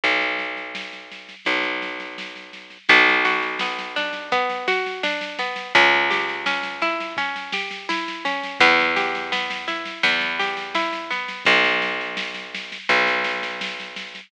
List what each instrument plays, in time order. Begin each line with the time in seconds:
0.04 electric bass (finger) B1, kick, snare
0.22 snare
0.39 snare
0.57 snare
0.75 snare
0.93 snare
1.12 snare
1.29 snare
1.45 electric bass (finger) B1, kick, snare
1.63 snare
1.82 snare
2.00 snare
2.18 snare
2.36 snare
2.53 snare
2.70 snare
2.89 electric bass (finger) B1, orchestral harp B3, kick, snare
3.08 snare
3.25 orchestral harp F#4, snare
3.42 snare
3.59 orchestral harp B3, snare
3.79 snare
3.96 orchestral harp D4, snare
4.13 snare
4.32 orchestral harp B3, kick, snare
4.50 snare
4.68 orchestral harp F#4, snare
4.86 snare
5.03 orchestral harp D4, snare
5.21 snare
5.39 orchestral harp B3, snare
5.56 snare
5.75 electric bass (finger) C#2, orchestral harp C#4, kick, snare
5.93 snare
6.11 orchestral harp G4, snare
6.29 snare
6.46 orchestral harp C#4, snare
6.63 snare
6.82 orchestral harp E4, snare
7.00 snare
7.17 orchestral harp C#4, kick, snare
7.36 snare
7.53 orchestral harp G4, snare
7.71 snare
7.89 orchestral harp E4, snare
8.08 snare
8.25 orchestral harp C#4, snare
8.43 snare
8.60 electric bass (finger) E2, orchestral harp B3, kick, snare
8.79 snare
8.96 orchestral harp G4, snare
9.15 snare
9.32 orchestral harp B3, snare
9.50 snare
9.68 orchestral harp E4, snare
9.86 snare
10.03 electric bass (finger) E2, orchestral harp B3, kick, snare
10.21 snare
10.39 orchestral harp G4, snare
10.57 snare
10.75 orchestral harp E4, snare
10.93 snare
11.11 orchestral harp B3, snare
11.29 snare
11.45 electric bass (finger) B1, kick, snare
11.64 snare
11.82 snare
12.01 snare
12.17 snare
12.34 snare
12.55 snare
12.72 snare
12.89 electric bass (finger) B1, kick, snare
13.07 snare
13.24 snare
13.43 snare
13.61 snare
13.80 snare
13.96 snare
14.15 snare